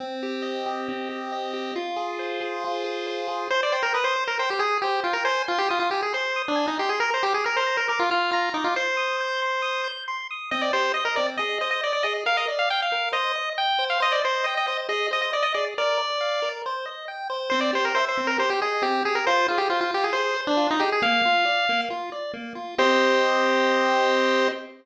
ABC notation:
X:1
M:4/4
L:1/16
Q:1/4=137
K:Cm
V:1 name="Lead 1 (square)"
z16 | z16 | c d c B =B c2 _B c G A2 G2 F B | c2 F G F F G A c3 D2 E G A |
B c G A B c2 B B F F2 F2 E F | c12 z4 | e d c2 e B d z e2 e e d d e z | f e z f g f3 e4 g3 f |
e d c2 e e e z e2 e e d e d z | d8 z8 | c d c B c c2 B c G A2 G2 A B | c2 F G F F G A c3 D2 E G A |
f8 z8 | c16 |]
V:2 name="Lead 1 (square)"
C2 G2 e2 G2 C2 G2 e2 G2 | F2 A2 c2 A2 F2 A2 c2 A2 | c2 g2 e'2 c2 g2 e'2 c2 g2 | a2 c'2 e'2 a2 c'2 e'2 a2 c'2 |
b2 d'2 f'2 b2 d'2 f'2 b2 d'2 | c'2 e'2 g'2 c'2 e'2 g'2 c'2 e'2 | C2 G2 e2 C2 A2 c2 e2 A2 | B2 d2 f2 B2 c2 e2 g2 c2 |
c2 e2 g2 c2 A2 c2 e2 A2 | B2 d2 f2 B2 c2 e2 g2 c2 | C2 G2 =e2 C2 G2 _e2 C2 G2 | F2 A2 c2 F2 A2 c2 F2 A2 |
B,2 F2 d2 B,2 F2 d2 B,2 F2 | [CGe]16 |]